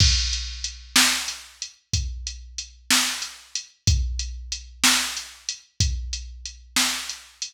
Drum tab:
CC |x-----------|------------|
HH |-xx-xxxxx-xx|xxx-xxxxx-xx|
SD |---o-----o--|---o-----o--|
BD |o-----o-----|o-----o-----|